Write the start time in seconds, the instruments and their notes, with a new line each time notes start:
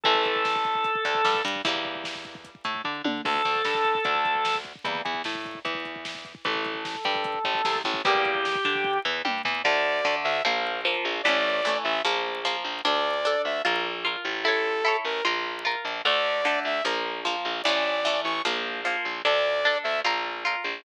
0.04 electric bass (finger) A1, acoustic guitar (steel) E3 A3, drawbar organ A4, kick, closed hi-hat
0.15 kick
0.25 kick, closed hi-hat
0.36 kick
0.45 kick, snare
0.56 kick
0.65 kick, closed hi-hat
0.75 kick
0.84 kick, closed hi-hat
0.95 kick
1.05 electric bass (finger) D2, acoustic guitar (steel) D3, kick, closed hi-hat
1.15 kick
1.25 electric bass (finger) G2, acoustic guitar (steel) G3, kick, snare
1.34 kick
1.45 electric bass (finger) G2, acoustic guitar (steel) G3, kick, closed hi-hat
1.56 kick
1.65 electric bass (finger) E2, acoustic guitar (steel) E3 G3 A#3, kick, closed hi-hat
1.75 kick
1.85 kick
1.95 kick
2.04 kick, snare
2.15 kick
2.24 kick, closed hi-hat
2.35 kick
2.45 kick, closed hi-hat
2.55 kick
2.64 electric bass (finger) A2, acoustic guitar (steel) A3, kick, closed hi-hat
2.75 kick
2.84 electric bass (finger) D3, acoustic guitar (steel) D4, kick
3.04 electric bass (finger) D3, acoustic guitar (steel) D4, high tom
3.25 electric bass (finger) D2, acoustic guitar (steel) D3 A3, drawbar organ A4, kick, crash
3.35 kick
3.45 electric bass (finger) D2, acoustic guitar (steel) D3, kick, closed hi-hat
3.55 kick
3.65 electric bass (finger) G2, acoustic guitar (steel) G3, kick, snare
3.75 kick
3.84 kick, closed hi-hat
3.95 kick
4.04 electric bass (finger) D2, acoustic guitar (steel) D3, kick, closed hi-hat
4.15 kick
4.25 kick, closed hi-hat
4.35 kick
4.45 kick, snare
4.55 kick
4.64 kick, closed hi-hat
4.75 kick
4.84 electric bass (finger) E2, acoustic guitar (steel) E3 G3 A#3, kick, closed hi-hat
4.95 kick
5.05 electric bass (finger) E2, acoustic guitar (steel) E3, kick, closed hi-hat
5.14 kick
5.24 electric bass (finger) A2, acoustic guitar (steel) A3, kick, snare
5.35 kick
5.45 kick, closed hi-hat
5.55 kick
5.65 electric bass (finger) E2, acoustic guitar (steel) E3, kick, closed hi-hat
5.75 kick
5.85 kick, closed hi-hat
5.96 kick
6.05 kick, snare
6.15 kick
6.25 kick, closed hi-hat
6.35 kick
6.44 electric bass (finger) A1, acoustic guitar (steel) E3 A3, drawbar organ A4, kick, closed hi-hat
6.55 kick
6.64 kick, closed hi-hat
6.75 kick
6.85 kick, snare
6.95 kick
7.05 electric bass (finger) G2, acoustic guitar (steel) G3, kick
7.15 kick
7.24 kick, closed hi-hat
7.34 kick
7.44 electric bass (finger) A1, acoustic guitar (steel) A2, kick, closed hi-hat
7.55 kick
7.65 electric bass (finger) C2, acoustic guitar (steel) C3, kick, snare
7.75 kick
7.84 electric bass (finger) A1, acoustic guitar (steel) A2, kick, closed hi-hat
7.94 kick
8.05 electric bass (finger) E2, acoustic guitar (steel) E3 G3 A#3, drawbar organ G4, kick, closed hi-hat
8.15 kick
8.25 kick, closed hi-hat
8.35 kick
8.45 kick, snare
8.55 kick
8.65 electric bass (finger) D3, acoustic guitar (steel) D4, kick, closed hi-hat
8.75 kick
8.84 kick
9.05 electric bass (finger) E2, acoustic guitar (steel) E3, floor tom
9.25 electric bass (finger) G2, acoustic guitar (steel) G3, high tom
9.45 electric bass (finger) E2, acoustic guitar (steel) E3, floor tom
9.64 electric bass (finger) D2, acoustic guitar (steel) D3 A3, lead 2 (sawtooth) D5
10.05 acoustic guitar (steel) D3 A3
10.24 electric bass (finger) D2, lead 2 (sawtooth) E5
10.45 electric bass (finger) A#1, acoustic guitar (steel) F3 A#3
10.85 acoustic guitar (steel) F3 A#3
11.05 electric bass (finger) A#1
11.23 electric bass (finger) A1, acoustic guitar (steel) E3 A3, lead 2 (sawtooth) D5
11.28 acoustic guitar (steel) C#4
11.65 acoustic guitar (steel) E3 A3 C#4
11.84 electric bass (finger) A1, lead 2 (sawtooth) E5
12.05 electric bass (finger) A#1, acoustic guitar (steel) F3 A#3
12.45 acoustic guitar (steel) F3 A#3
12.64 electric bass (finger) A#1
12.85 electric bass (finger) D2, acoustic guitar (steel) D4 A4, lead 2 (sawtooth) D5
13.25 acoustic guitar (steel) D4 A4
13.45 electric bass (finger) D2, lead 2 (sawtooth) E5
13.65 electric bass (finger) A#1, acoustic guitar (steel) F4 A#4
14.05 acoustic guitar (steel) F4 A#4
14.25 electric bass (finger) A1
14.44 acoustic guitar (steel) E4 A4, lead 2 (sawtooth) A4
14.48 acoustic guitar (steel) C#5
14.85 acoustic guitar (steel) E4 A4 C#5
15.05 electric bass (finger) A1, lead 2 (sawtooth) A#4
15.25 electric bass (finger) A#1, acoustic guitar (steel) F4 A#4
15.65 acoustic guitar (steel) F4 A#4
15.85 electric bass (finger) A#1
16.05 electric bass (finger) D2, acoustic guitar (steel) D3 A3, lead 2 (sawtooth) D5
16.45 acoustic guitar (steel) D3 A3
16.65 electric bass (finger) D2, lead 2 (sawtooth) E5
16.84 electric bass (finger) A#1, acoustic guitar (steel) F3 A#3
17.25 acoustic guitar (steel) F3 A#3
17.45 electric bass (finger) A#1
17.64 electric bass (finger) A1, acoustic guitar (steel) E3 A3, lead 2 (sawtooth) D5
17.69 acoustic guitar (steel) C#4
18.05 acoustic guitar (steel) E3 A3 C#4
18.24 electric bass (finger) A1, lead 2 (sawtooth) C#6
18.45 electric bass (finger) A#1, acoustic guitar (steel) F3 A#3
18.85 acoustic guitar (steel) F3 A#3
19.05 electric bass (finger) A#1
19.25 electric bass (finger) D2, acoustic guitar (steel) D4 A4, lead 2 (sawtooth) D5
19.65 acoustic guitar (steel) D4 A4
19.84 electric bass (finger) D2, lead 2 (sawtooth) E5
20.04 electric bass (finger) A#1, acoustic guitar (steel) F4 A#4
20.45 acoustic guitar (steel) F4 A#4
20.64 electric bass (finger) A#1